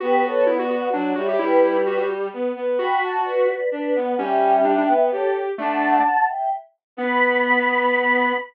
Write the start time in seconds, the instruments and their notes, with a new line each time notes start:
0.00 violin B3, lead 1 (square) F#4, choir aahs G4 B4
0.23 choir aahs A4 C#5
0.47 lead 1 (square) E4, choir aahs D5 F#5
0.59 lead 1 (square) F#4
0.70 lead 1 (square) F#4
0.93 violin F#3, lead 1 (square) D4, choir aahs D5 F#5
1.16 violin G3, lead 1 (square) F#4, choir aahs C#5 E5
1.28 lead 1 (square) G4
1.39 violin G3, lead 1 (square) E4, choir aahs G4 B4
1.62 choir aahs B4 D5
1.86 lead 1 (square) F#4
1.97 lead 1 (square) F#4
2.33 violin B3
2.56 violin B3
2.78 violin F#4, lead 1 (square) F#4, choir aahs G5 B5
3.02 choir aahs F#5 A5
3.25 choir aahs B4 D5
3.72 violin D4, choir aahs B4 D5
3.95 violin B3, choir aahs D5 F#5
4.18 violin G3, lead 1 (square) C#4, choir aahs E5 G5
4.65 lead 1 (square) D4
4.78 lead 1 (square) D4
4.89 violin B3
5.12 violin G4, choir aahs A4 C#5
5.58 lead 1 (square) A3, violin D4, choir aahs F#5 A5
6.28 choir aahs E5 G5
6.97 violin B3, lead 1 (square) B3, choir aahs B5